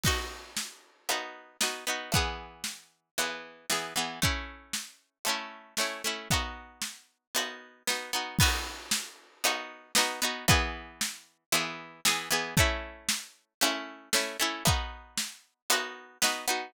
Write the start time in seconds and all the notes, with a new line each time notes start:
0.04 B3 D#4 F#4, kick, crash
0.57 snare
1.09 B3 D#4 F#4, closed hi-hat
1.61 B3 D#4 F#4, snare
1.87 B3 D#4 F#4
2.12 E3 B3, kick, closed hi-hat
2.17 G#4
2.64 snare
3.18 E3 B3 G#4, closed hi-hat
3.70 E3 B3 G#4, snare
3.96 E3 B3 G#4
4.22 A3 C#4 E4, kick
4.73 snare
5.25 A3 C#4, closed hi-hat
5.29 E4
5.77 A3 C#4 E4, snare
6.04 A3 C#4 E4
6.31 B3 D#4 F#4, kick, closed hi-hat
6.82 snare
7.35 B3 D#4 F#4, closed hi-hat
7.87 B3 D#4 F#4, snare
8.13 B3 D#4 F#4
8.39 B3 D#4 F#4, kick, crash
8.91 snare
9.44 B3 D#4 F#4, closed hi-hat
9.95 B3 D#4 F#4, snare
10.22 B3 D#4 F#4
10.48 E3 B3 G#4, kick, closed hi-hat
11.01 snare
11.52 E3 B3 G#4, closed hi-hat
12.05 E3 B3 G#4, snare
12.31 E3 B3 G#4
12.57 A3 C#4 E4, kick
13.09 snare
13.61 A3 C#4 E4, closed hi-hat
14.13 A3 C#4 E4, snare
14.40 A3 C#4 E4
14.65 B3 D#4 F#4, kick, closed hi-hat
15.17 snare
15.70 B3 D#4 F#4, closed hi-hat
16.22 B3 D#4 F#4, snare
16.48 B3 D#4 F#4